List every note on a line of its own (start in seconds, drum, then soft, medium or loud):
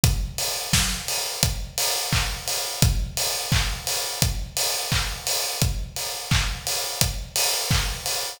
0.03 kick loud
0.03 closed hi-hat loud
0.38 open hi-hat medium
0.73 kick medium
0.73 snare loud
1.08 open hi-hat medium
1.43 kick medium
1.43 closed hi-hat loud
1.78 open hi-hat medium
2.12 kick medium
2.12 clap loud
2.48 open hi-hat medium
2.82 kick loud
2.82 closed hi-hat loud
3.17 open hi-hat medium
3.52 kick loud
3.52 clap loud
3.87 open hi-hat medium
4.22 kick medium
4.22 closed hi-hat loud
4.57 open hi-hat medium
4.92 kick medium
4.92 clap loud
5.27 open hi-hat medium
5.61 kick loud
5.61 closed hi-hat medium
5.96 open hi-hat medium
6.31 kick loud
6.31 clap loud
6.67 open hi-hat medium
7.01 kick medium
7.01 closed hi-hat loud
7.36 open hi-hat loud
7.71 kick loud
7.71 clap loud
8.06 open hi-hat medium